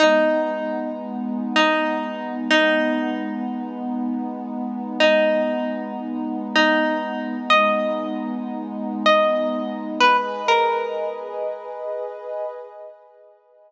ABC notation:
X:1
M:4/4
L:1/16
Q:"Swing 16ths" 1/4=96
K:G#m
V:1 name="Pizzicato Strings"
D6 z4 D5 z | D4 z12 | D6 z4 D5 z | d6 z4 d5 z |
B z2 A5 z8 |]
V:2 name="Pad 2 (warm)"
[G,B,D]16 | [G,B,D]16 | [G,B,D]16 | [G,B,D]16 |
[GBd]16 |]